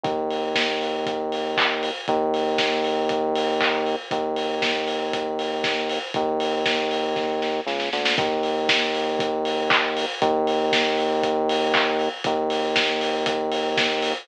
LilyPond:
<<
  \new Staff \with { instrumentName = "Synth Bass 1" } { \clef bass \time 4/4 \key ees \dorian \tempo 4 = 118 ees,1 | ees,1 | ees,1 | ees,2. des,8 d,8 |
ees,1 | ees,1 | ees,1 | }
  \new DrumStaff \with { instrumentName = "Drums" } \drummode { \time 4/4 <hh bd>8 hho8 <bd sn>8 hho8 <hh bd>8 hho8 <hc bd>8 hho8 | <hh bd>8 hho8 <bd sn>8 hho8 <hh bd>8 hho8 <hc bd>8 hho8 | <hh bd>8 hho8 <bd sn>8 hho8 <hh bd>8 hho8 <bd sn>8 hho8 | <hh bd>8 hho8 <bd sn>8 hho8 <bd sn>8 sn8 sn16 sn16 sn16 sn16 |
<hh bd>8 hho8 <bd sn>8 hho8 <hh bd>8 hho8 <hc bd>8 hho8 | <hh bd>8 hho8 <bd sn>8 hho8 <hh bd>8 hho8 <hc bd>8 hho8 | <hh bd>8 hho8 <bd sn>8 hho8 <hh bd>8 hho8 <bd sn>8 hho8 | }
>>